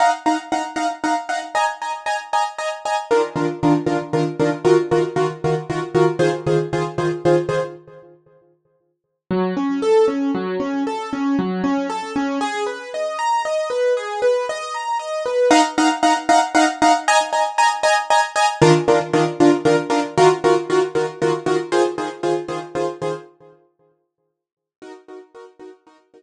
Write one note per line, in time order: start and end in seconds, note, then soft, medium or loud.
0.00 0.10 D#4 medium
0.00 0.10 F5 medium
0.00 0.10 F#5 medium
0.00 0.10 A#5 medium
0.26 0.36 D#4 medium
0.26 0.36 F5 medium
0.26 0.36 F#5 medium
0.26 0.36 A#5 medium
0.52 0.62 D#4 medium
0.52 0.62 F5 medium
0.52 0.62 F#5 medium
0.52 0.62 A#5 medium
0.76 0.86 D#4 medium
0.76 0.86 F5 medium
0.76 0.86 F#5 medium
0.76 0.86 A#5 medium
1.04 1.14 D#4 medium
1.04 1.14 F5 medium
1.04 1.14 F#5 medium
1.04 1.14 A#5 medium
1.29 1.39 D#4 medium
1.29 1.39 F5 medium
1.29 1.39 F#5 medium
1.29 1.39 A#5 medium
1.55 1.65 D#5 medium
1.55 1.65 G#5 medium
1.55 1.65 A#5 medium
1.82 1.92 D#5 medium
1.82 1.92 G#5 medium
1.82 1.92 A#5 medium
2.06 2.16 D#5 medium
2.06 2.16 G#5 medium
2.06 2.16 A#5 medium
2.33 2.43 D#5 medium
2.33 2.43 G#5 medium
2.33 2.43 A#5 medium
2.58 2.69 D#5 medium
2.58 2.69 G#5 medium
2.58 2.69 A#5 medium
2.85 2.96 D#5 medium
2.85 2.96 G#5 medium
2.85 2.96 A#5 medium
3.11 3.21 D#3 medium
3.11 3.21 D4 medium
3.11 3.21 F4 medium
3.11 3.21 A#4 medium
3.36 3.46 D#3 medium
3.36 3.46 D4 medium
3.36 3.46 F4 medium
3.36 3.46 A#4 medium
3.63 3.73 D#3 medium
3.63 3.73 D4 medium
3.63 3.73 F4 medium
3.63 3.73 A#4 medium
3.86 3.97 D#3 medium
3.86 3.97 D4 medium
3.86 3.97 F4 medium
3.86 3.97 A#4 medium
4.13 4.23 D#3 medium
4.13 4.23 D4 medium
4.13 4.23 F4 medium
4.13 4.23 A#4 medium
4.39 4.50 D#3 medium
4.39 4.50 D4 medium
4.39 4.50 F4 medium
4.39 4.50 A#4 medium
4.65 4.75 D#3 medium
4.65 4.75 F4 medium
4.65 4.75 F#4 medium
4.65 4.75 A#4 medium
4.91 5.02 D#3 medium
4.91 5.02 F4 medium
4.91 5.02 F#4 medium
4.91 5.02 A#4 medium
5.16 5.26 D#3 medium
5.16 5.26 F4 medium
5.16 5.26 F#4 medium
5.16 5.26 A#4 medium
5.44 5.55 D#3 medium
5.44 5.55 F4 medium
5.44 5.55 F#4 medium
5.44 5.55 A#4 medium
5.70 5.80 D#3 medium
5.70 5.80 F4 medium
5.70 5.80 F#4 medium
5.70 5.80 A#4 medium
5.95 6.05 D#3 medium
5.95 6.05 F4 medium
5.95 6.05 F#4 medium
5.95 6.05 A#4 medium
6.19 6.30 D#3 medium
6.19 6.30 F4 medium
6.19 6.30 G#4 medium
6.19 6.30 C5 medium
6.47 6.57 D#3 medium
6.47 6.57 F4 medium
6.47 6.57 G#4 medium
6.47 6.57 C5 medium
6.73 6.83 D#3 medium
6.73 6.83 F4 medium
6.73 6.83 G#4 medium
6.73 6.83 C5 medium
6.98 7.08 D#3 medium
6.98 7.08 F4 medium
6.98 7.08 G#4 medium
6.98 7.08 C5 medium
7.25 7.35 D#3 medium
7.25 7.35 F4 medium
7.25 7.35 G#4 medium
7.25 7.35 C5 medium
7.49 7.59 D#3 medium
7.49 7.59 F4 medium
7.49 7.59 G#4 medium
7.49 7.59 C5 medium
9.31 9.54 F#3 medium
9.57 9.80 C#4 medium
9.82 10.06 A4 medium
10.08 10.31 C#4 medium
10.35 10.58 F#3 medium
10.60 10.83 C#4 medium
10.87 11.10 A4 medium
11.13 11.36 C#4 medium
11.39 11.62 F#3 medium
11.64 11.87 C#4 medium
11.90 12.13 A4 medium
12.16 12.39 C#4 medium
12.41 12.64 G#4 loud
12.66 12.90 B4 medium
12.94 13.17 D#5 medium
13.19 13.42 A#5 medium
13.45 13.68 D#5 medium
13.70 13.93 B4 medium
13.97 14.20 G#4 medium
14.22 14.45 B4 medium
14.49 14.73 D#5 medium
14.74 14.98 A#5 medium
14.99 15.23 D#5 medium
15.26 15.49 B4 medium
15.51 15.61 D#4 loud
15.51 15.61 F5 loud
15.51 15.61 F#5 loud
15.51 15.61 A#5 loud
15.78 15.88 D#4 medium
15.78 15.88 F5 loud
15.78 15.88 F#5 medium
15.78 15.88 A#5 loud
16.03 16.13 D#4 medium
16.03 16.13 F5 medium
16.03 16.13 F#5 loud
16.03 16.13 A#5 medium
16.29 16.39 D#4 medium
16.29 16.39 F5 loud
16.29 16.39 F#5 loud
16.29 16.39 A#5 medium
16.55 16.65 D#4 loud
16.55 16.65 F5 loud
16.55 16.65 F#5 loud
16.55 16.65 A#5 medium
16.82 16.92 D#4 loud
16.82 16.92 F5 medium
16.82 16.92 F#5 loud
16.82 16.92 A#5 medium
17.08 17.18 D#5 loud
17.08 17.18 G#5 loud
17.08 17.18 A#5 loud
17.33 17.43 D#5 medium
17.33 17.43 G#5 medium
17.33 17.43 A#5 medium
17.58 17.68 D#5 medium
17.58 17.68 G#5 loud
17.58 17.68 A#5 loud
17.83 17.94 D#5 loud
17.83 17.94 G#5 loud
17.83 17.94 A#5 loud
18.10 18.21 D#5 loud
18.10 18.21 G#5 medium
18.10 18.21 A#5 medium
18.36 18.46 D#5 medium
18.36 18.46 G#5 loud
18.36 18.46 A#5 loud
18.62 18.72 D#3 loud
18.62 18.72 D4 loud
18.62 18.72 F4 loud
18.62 18.72 A#4 loud
18.88 18.98 D#3 medium
18.88 18.98 D4 medium
18.88 18.98 F4 medium
18.88 18.98 A#4 medium
19.13 19.24 D#3 loud
19.13 19.24 D4 medium
19.13 19.24 F4 medium
19.13 19.24 A#4 medium
19.40 19.51 D#3 medium
19.40 19.51 D4 medium
19.40 19.51 F4 loud
19.40 19.51 A#4 medium
19.65 19.75 D#3 medium
19.65 19.75 D4 medium
19.65 19.75 F4 medium
19.65 19.75 A#4 loud
19.90 20.00 D#3 loud
19.90 20.00 D4 loud
19.90 20.00 F4 loud
19.90 20.00 A#4 loud
20.18 20.28 D#3 loud
20.18 20.28 F4 loud
20.18 20.28 F#4 loud
20.18 20.28 A#4 loud
20.44 20.54 D#3 loud
20.44 20.54 F4 medium
20.44 20.54 F#4 medium
20.44 20.54 A#4 loud
20.70 20.80 D#3 medium
20.70 20.80 F4 loud
20.70 20.80 F#4 loud
20.70 20.80 A#4 medium
20.95 21.05 D#3 medium
20.95 21.05 F4 medium
20.95 21.05 F#4 medium
20.95 21.05 A#4 medium
21.22 21.32 D#3 medium
21.22 21.32 F4 medium
21.22 21.32 F#4 loud
21.22 21.32 A#4 medium
21.46 21.57 D#3 loud
21.46 21.57 F4 medium
21.46 21.57 F#4 loud
21.46 21.57 A#4 loud
21.72 21.82 D#3 loud
21.72 21.82 F4 loud
21.72 21.82 G#4 loud
21.72 21.82 C5 loud
21.98 22.08 D#3 loud
21.98 22.08 F4 medium
21.98 22.08 G#4 loud
21.98 22.08 C5 medium
22.23 22.34 D#3 medium
22.23 22.34 F4 loud
22.23 22.34 G#4 loud
22.23 22.34 C5 medium
22.48 22.59 D#3 loud
22.48 22.59 F4 medium
22.48 22.59 G#4 medium
22.48 22.59 C5 medium
22.75 22.85 D#3 loud
22.75 22.85 F4 loud
22.75 22.85 G#4 medium
22.75 22.85 C5 medium
23.02 23.12 D#3 medium
23.02 23.12 F4 medium
23.02 23.12 G#4 loud
23.02 23.12 C5 medium
24.82 24.92 D#4 medium
24.82 24.92 F#4 medium
24.82 24.92 A#4 medium
25.08 25.19 D#4 medium
25.08 25.19 F#4 medium
25.08 25.19 A#4 medium
25.35 25.45 D#4 medium
25.35 25.45 F#4 medium
25.35 25.45 A#4 medium
25.59 25.70 D#4 medium
25.59 25.70 F#4 medium
25.59 25.70 A#4 medium
25.87 25.97 D#4 medium
25.87 25.97 F#4 medium
25.87 25.97 A#4 medium
26.14 26.22 D#4 medium
26.14 26.22 F#4 medium
26.14 26.22 A#4 medium